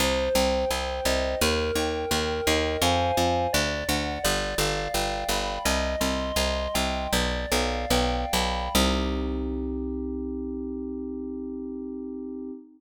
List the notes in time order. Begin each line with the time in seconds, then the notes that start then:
0.00 C2 C5
0.35 C2 G5
0.70 C2 C5
1.05 C2 D#5
1.41 D#2 A#4
1.75 D#2 G5
2.11 D#2 A#4
2.47 D#2 D#5
2.82 F2 C5 F5 G#5
3.17 F2
3.53 D2 D5
3.88 D2 F#5
4.24 G1 D5
4.58 G1 F5
4.94 G1 G5
5.29 G1 B5
5.65 C2 D#5
6.00 C2 C6
6.36 C2 D#5
6.74 C2 G5
7.12 B1 D5
7.52 B1 F5
7.90 B1 G5
8.33 B1 B5
8.75 C2 C4 D#4 G4